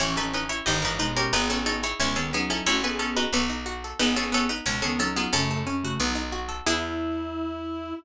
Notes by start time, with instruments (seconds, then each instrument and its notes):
0.00 electric bass (finger) A1, clarinet E3 C#4, harpsichord C#4 E4 C#5
0.17 clarinet E3 C#4, harpsichord D#4 A4 B4
0.33 harpsichord C#4 D#4 B4
0.49 harpsichord E4 C#5
0.66 electric bass (finger) G1, clarinet G2 D#3, harpsichord D#4 G4 D#5
0.82 clarinet G#2 E3, harpsichord D#4 A#4 B4
0.99 clarinet B2 G#3, harpsichord D#4 B4
1.17 harpsichord C#4 G4 A#4
1.33 electric bass (finger) G#1, clarinet B3 G#4, harpsichord D#4 B4
1.50 clarinet B3 G#4, harpsichord C#4 A4 B4
1.66 harpsichord C#4 D#4 A4
1.83 harpsichord E4 G#4 C#5
2.00 electric bass (finger) C#2, clarinet B2 G#3, harpsichord C#4 E4 C#5
2.16 clarinet D#3 B3, harpsichord C#4 G#4 A4
2.33 clarinet F#3 D#4, harpsichord B3 C#4 G#4
2.50 harpsichord C#4 E4 A4
2.66 electric bass (finger) A1, clarinet A3 F#4, harpsichord C#4 E4 C#5
2.83 clarinet B3 G#4, harpsichord A4 B4 G#5
2.99 harpsichord C#4 A4
3.17 harpsichord D#4 F#4 B4
3.33 electric bass (finger) B1, harpsichord B3 C#4 A4
3.50 harpsichord D#4
3.66 harpsichord F#4
3.84 harpsichord A4
3.99 electric bass (finger) G#1, harpsichord B3 D#4 B4, clarinet B3 G#4
4.16 clarinet B3 G#4, harpsichord C#4 G#4 A4
4.32 harpsichord B3 C#4 A4
4.49 harpsichord D#4 B4
4.66 electric bass (finger) C#2, clarinet B2 G#3, harpsichord C#4 C#5 A5
4.82 clarinet D#3 B3, harpsichord C#4 G#4 A4
4.99 clarinet F#3 D#4, harpsichord C#4 A4
5.16 harpsichord B3 F4 G#4
5.33 electric bass (finger) F#2, clarinet C#3 A3, harpsichord C#4 A4
5.51 harpsichord A4
5.67 harpsichord C#4
5.83 clarinet C#3 A3, harpsichord F#4
5.99 electric bass (finger) B1, clarinet F#3 D#4, harpsichord B3
6.15 harpsichord D#4
6.32 harpsichord F#4
6.49 harpsichord A4
6.66 electric bass (finger) E2, harpsichord B3 E4 G#4, clarinet E4